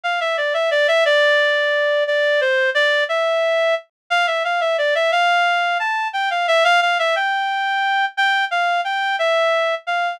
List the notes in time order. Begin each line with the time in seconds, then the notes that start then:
0.04 F5
0.20 E5
0.37 D5
0.54 E5
0.71 D5
0.88 E5
1.05 D5
2.07 D5
2.41 C5
2.75 D5
3.09 E5
4.10 F5
4.27 E5
4.44 F5
4.61 E5
4.78 D5
4.95 E5
5.12 F5
5.80 A5
6.13 G5
6.30 F5
6.48 E5
6.64 F5
6.82 F5
6.99 E5
7.16 G5
8.17 G5
8.51 F5
8.84 G5
9.19 E5
9.87 F5